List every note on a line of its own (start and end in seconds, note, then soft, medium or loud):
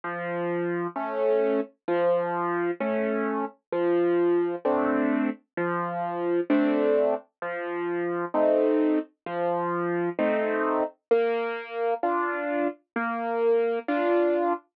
0.04 0.87 F3 loud
0.96 1.60 A3 medium
0.96 1.60 C#4 medium
1.88 2.71 F3 loud
2.80 3.45 A3 medium
2.80 3.45 C#4 medium
3.72 4.55 F3 loud
4.65 5.29 A3 medium
4.65 5.29 C4 medium
4.65 5.29 D4 medium
5.57 6.40 F3 loud
6.50 7.14 A3 medium
6.50 7.14 C4 medium
6.50 7.14 D4 medium
7.42 8.25 F3 loud
8.34 8.99 A3 medium
8.34 8.99 C4 medium
8.34 8.99 D#4 medium
9.26 10.09 F3 loud
10.19 10.83 A3 medium
10.19 10.83 C4 medium
10.19 10.83 D#4 medium
11.11 11.94 A#3 loud
12.03 12.68 D4 medium
12.03 12.68 F4 medium
12.96 13.79 A#3 loud
13.88 14.53 D4 medium
13.88 14.53 F4 medium